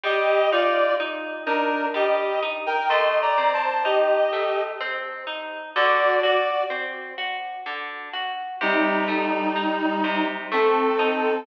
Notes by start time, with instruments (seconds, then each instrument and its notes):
0.04 orchestral harp G3, clarinet G4 D#5
0.52 orchestral harp D#4, clarinet F4 D5
1.00 orchestral harp D#4
1.46 clarinet D4 A#4, orchestral harp D#4
1.94 orchestral harp G3, clarinet G4 D#5
2.42 orchestral harp D#4
2.66 clarinet A#4 G5
2.89 orchestral harp A3, clarinet D#5 C6
3.22 clarinet D5 A#5
3.38 orchestral harp C4
3.53 clarinet C5 A5
3.85 orchestral harp D#4, clarinet G4 D#5
4.33 orchestral harp A3
4.81 orchestral harp C4
5.27 orchestral harp D#4
5.76 orchestral harp D3, clarinet F#4 D5
6.23 clarinet F#4 D5, orchestral harp F#4
6.70 orchestral harp C4
7.18 orchestral harp F#4
7.66 orchestral harp D3
8.13 orchestral harp F#4
8.61 orchestral harp C3, clarinet G3 D#4
9.08 orchestral harp A3
9.56 orchestral harp D#4
10.04 orchestral harp C3
10.52 orchestral harp A3, clarinet C4 A4
10.99 orchestral harp D#4